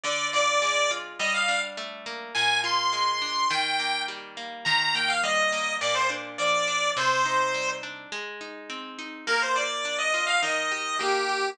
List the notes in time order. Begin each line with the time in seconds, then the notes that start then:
0.04 D3 D5
0.33 F4 D5
0.62 G#3
0.91 F4
1.19 G3 D#5
1.34 F5
1.49 D4
1.77 A3
2.06 A#3
2.35 A#2 G#5
2.64 F4 C6
2.93 G#3
3.22 D4
3.50 D#3 G5
3.79 A#3
4.08 G3
4.37 A#3
4.65 D#3 A#5
4.81 A#5
4.95 A#3 G5
5.08 F5
5.23 G3 D#5
5.52 A#3
5.81 A#2 D5
5.95 C5
6.10 D4
6.38 F3 D5
6.68 D4
6.97 C3 C5
7.26 D#4
7.54 G3
7.83 D4
8.12 G#3
8.41 D#4
8.70 C4
8.99 D#4
9.27 A#3 A#4
9.42 C5
9.56 F4 D5
9.85 D4
9.99 D#5
10.14 F4
10.27 F5
10.42 D#3 D#5
10.72 G4
10.99 A#3 G4
11.29 G4